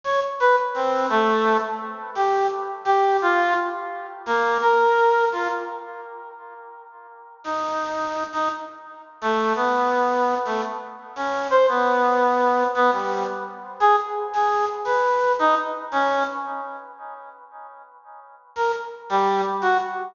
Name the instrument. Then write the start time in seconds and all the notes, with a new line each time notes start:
clarinet
0.04 C#5
0.40 B4
0.74 C4
1.10 A3
2.15 G4
2.85 G4
3.22 F4
4.26 A#3
4.61 A#4
5.32 F4
7.44 D#4
8.33 D#4
9.21 A3
9.55 B3
10.45 A3
11.16 C#4
11.50 C5
11.68 B3
12.75 B3
12.92 G3
13.80 G#4
14.33 G#4
14.85 B4
15.39 D#4
15.92 C#4
18.56 A#4
19.10 G3
19.62 F#4